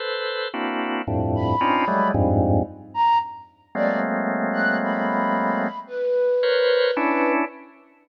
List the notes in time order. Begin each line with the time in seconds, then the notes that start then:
0.00 A4 B4 C5
0.54 A#3 C4 D4 E4 F#4
1.07 F2 G2 A2
1.35 B5
1.61 C4 C#4 D4 D#4 F4
1.88 F#3 G3 G#3 A3
2.14 F2 G2 G#2
2.94 A#5
3.75 F#3 G#3 A3 A#3 C4 D5
4.53 F#6
4.83 B5
5.87 B4
6.43 A#4 B4 C5 C#5
6.97 C#4 D4 E4